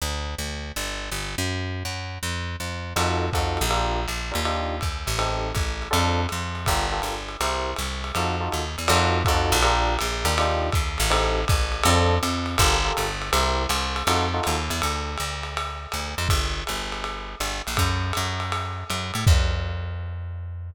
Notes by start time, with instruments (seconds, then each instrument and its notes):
0.02 electric bass (finger) D2
0.38 electric bass (finger) D2
0.76 electric bass (finger) G1
1.11 electric bass (finger) G1
1.38 electric bass (finger) F#2
1.85 electric bass (finger) F#2
2.23 electric bass (finger) F2
2.60 electric bass (finger) F2
2.96 electric bass (finger) F2, electric piano 1 D#4 F4 F#4 A4, crash, ride
3.33 electric bass (finger) F2, electric piano 1 D#4 F4 F#4 A4, kick, hi-hat pedal, ride
3.57 ride
3.61 electric bass (finger) A#1
3.70 electric piano 1 D4 F4 G4 A#4, ride
4.08 electric bass (finger) A#1, hi-hat pedal, ride
4.31 electric bass (finger) D#2, electric piano 1 D4 F4 G4 A#4, ride
4.45 electric piano 1 D4 D#4 F4 G4, ride
4.81 electric bass (finger) D#2, kick, hi-hat pedal, ride
5.07 electric bass (finger) A1, ride
5.18 electric piano 1 C4 D#4 G4 A4, ride
5.55 electric bass (finger) A1, kick, hi-hat pedal, ride
5.82 ride
5.91 electric bass (finger) F2, electric piano 1 C4 D4 F4 A4, ride
6.29 electric bass (finger) F2, hi-hat pedal, ride
6.55 ride
6.66 electric bass (finger) G1, electric piano 1 F4 G4 A4 A#4, kick, ride
6.92 electric piano 1 F4 G4 A4 A#4
7.02 electric bass (finger) G1, hi-hat pedal, ride
7.29 ride
7.41 electric bass (finger) C2, electric piano 1 E4 G4 A#4 C5, ride
7.76 electric bass (finger) C2, hi-hat pedal, ride
8.04 ride
8.15 electric bass (finger) F2, electric piano 1 D#4 F4 F#4 A4, ride
8.40 electric piano 1 D#4 F4 F#4 A4
8.52 electric bass (finger) D#2, hi-hat pedal, ride
8.78 electric bass (finger) E2, ride
8.88 electric bass (finger) F2, electric piano 1 D#4 F4 F#4 A4, crash, ride
9.25 electric bass (finger) F2, electric piano 1 D#4 F4 F#4 A4, kick, hi-hat pedal, ride
9.52 electric bass (finger) A#1, ride
9.62 electric piano 1 D4 F4 G4 A#4, ride
9.99 electric bass (finger) A#1, hi-hat pedal, ride
10.25 electric bass (finger) D#2, electric piano 1 D4 F4 G4 A#4, ride
10.38 electric piano 1 D4 D#4 F4 G4, ride
10.72 electric bass (finger) D#2, kick, hi-hat pedal, ride
10.98 electric bass (finger) A1, ride
11.10 electric piano 1 C4 D#4 G4 A4, ride
11.48 electric bass (finger) A1, kick, hi-hat pedal, ride
11.72 ride
11.83 electric bass (finger) F2, electric piano 1 C4 D4 F4 A4, ride
12.23 electric bass (finger) F2, hi-hat pedal, ride
12.46 ride
12.58 electric bass (finger) G1, electric piano 1 F4 G4 A4 A#4, kick, ride
12.84 electric piano 1 F4 G4 A4 A#4
12.97 electric bass (finger) G1, hi-hat pedal, ride
13.22 ride
13.32 electric bass (finger) C2, electric piano 1 E4 G4 A#4 C5, ride
13.69 electric bass (finger) C2, hi-hat pedal, ride
13.96 ride
14.07 electric bass (finger) F2, electric piano 1 D#4 F4 F#4 A4, ride
14.34 electric piano 1 D#4 F4 F#4 A4
14.43 electric bass (finger) D#2, hi-hat pedal, ride
14.70 electric bass (finger) E2, ride
14.82 electric bass (finger) D2, ride
15.18 electric bass (finger) D2, hi-hat pedal, ride
15.43 ride
15.57 ride
15.92 electric bass (finger) D2, hi-hat pedal, ride
16.18 electric bass (finger) F2, ride
16.29 electric bass (finger) G1, kick, ride
16.67 electric bass (finger) G1, hi-hat pedal, ride
16.92 ride
17.04 ride
17.40 electric bass (finger) G1, hi-hat pedal, ride
17.67 electric bass (finger) A#1, ride
17.77 electric bass (finger) F#2, kick, ride
18.13 electric bass (finger) F#2, hi-hat pedal, ride
18.40 ride
18.52 ride
18.90 electric bass (finger) F#2, hi-hat pedal, ride
19.14 electric bass (finger) A2, ride
19.27 electric bass (finger) F2, kick, crash